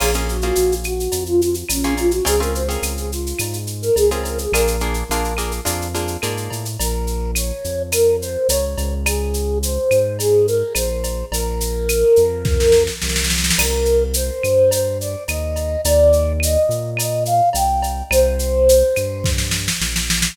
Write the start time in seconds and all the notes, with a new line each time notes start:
0.00 A#1 A#3 C#4 F4 G#4, crash, cowbell, claves
0.14 A#3 C#4 F4 G#4, shaker
0.28 F#4, shaker
0.42 A#3 C#4 F4 G#4, shaker
0.55 A#1, shaker
0.72 shaker
0.84 F#4, claves, shaker
1.00 shaker
1.12 F2, cowbell, shaker
1.26 F4, shaker
1.42 F4, shaker
1.54 shaker
1.69 A#1 C#4, cowbell, claves, shaker
1.83 A#3 C#4 F4 G#4, shaker
1.97 F4, cowbell, shaker
2.11 F#4, shaker
2.25 C#2 C4 C#4 F4 G#4, cowbell, shaker
2.40 C4 C#4 F4 G#4 A#4, shaker
2.55 C5, shaker
2.69 C4 C#4 F4 G#4 A#4, shaker
2.82 C#2, claves, shaker
2.97 G#4, shaker
3.11 F4, shaker
3.26 shaker
3.39 G#2, cowbell, claves, shaker
3.53 shaker
3.67 shaker
3.82 A#4, shaker
3.96 C#2 G#4, cowbell, shaker
4.10 C4 C#4 F4 G#4 A#4, shaker
4.23 A#4, cowbell, shaker
4.38 G#4, shaker
4.52 A#1 A#3 D4 F4 G#4 A#4, cowbell, claves, shaker
4.67 shaker
4.80 A#3 D4 F4 G#4, shaker
4.94 shaker
5.09 A#1 A#3 D4 F4 G#4, shaker
5.24 shaker
5.37 A#3 D4 F4 G#4, claves, shaker
5.51 shaker
5.65 F2 A#3 D4 F4 G#4, cowbell, shaker
5.81 shaker
5.94 A#3 D4 F4 G#4, shaker
6.08 shaker
6.22 G#2 A#3 D4 F4 G#4, cowbell, claves, shaker
6.37 shaker
6.50 A2, cowbell, shaker
6.65 shaker
6.79 A#1 A#4, cowbell, shaker
7.07 shaker
7.35 C#5, claves, shaker
7.64 F2, shaker
7.92 A#4, cowbell, claves, shaker
8.21 C5, shaker
8.49 C#2 C#5, cowbell, shaker
8.78 C#2, cowbell, shaker
9.06 G#4, cowbell, claves, shaker
9.34 shaker
9.62 C5, shaker
9.91 G#2, claves, shaker
10.19 G#4, cowbell, shaker
10.47 A#4, shaker
10.75 A#1 C5, cowbell, claves, shaker
11.04 cowbell, shaker
11.32 A#1 A#4, cowbell, shaker
11.60 shaker
11.89 claves, shaker
12.16 F2, shaker
12.45 kick, snare
12.60 snare
12.72 snare
12.87 snare
13.02 C2, snare
13.09 snare
13.16 snare
13.24 snare
13.30 snare
13.38 snare
13.44 snare
13.50 snare
13.58 C2 A#4, crash, cowbell, claves
13.85 shaker
14.14 C5, shaker
14.43 G2, claves, shaker
14.71 C5, cowbell, shaker
15.00 D5, shaker
15.28 D#2 D#5, cowbell, claves, shaker
15.56 cowbell, shaker
15.85 D#2 D5, cowbell, shaker
16.13 shaker
16.40 D#5, claves, shaker
16.69 A#2, shaker
16.97 D#5, cowbell, claves, shaker
17.25 F5, shaker
17.53 C2 G5, cowbell, shaker
17.82 cowbell, shaker
18.11 C2 C5, cowbell, claves, shaker
18.39 shaker
18.69 shaker
18.96 G2, claves, shaker
19.24 kick, snare
19.38 snare
19.51 snare
19.68 snare
19.81 A#1, snare
19.96 snare
20.10 snare
20.22 snare